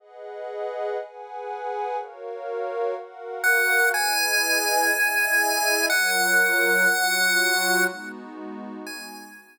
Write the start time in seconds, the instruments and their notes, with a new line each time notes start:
0.00 pad 5 (bowed) G#4 B4 D#5 F#5
1.00 pad 5 (bowed) G#4 B4 F#5 G#5
1.97 pad 5 (bowed) F#4 A#4 C#5 F5
2.96 pad 5 (bowed) F#4 A#4 F5 F#5
3.44 lead 1 (square) F#5
3.93 pad 5 (bowed) E4 G#4 B4 D#5, lead 1 (square) G#5
4.92 pad 5 (bowed) E4 G#4 D#5 E5
5.89 pad 5 (bowed) F#3 F4 A#4 C#5, lead 1 (square) F#5
6.89 pad 5 (bowed) F#3 F4 F#4 C#5
7.87 pad 5 (bowed) G#3 B3 D#4 F#4
8.87 lead 1 (square) G#5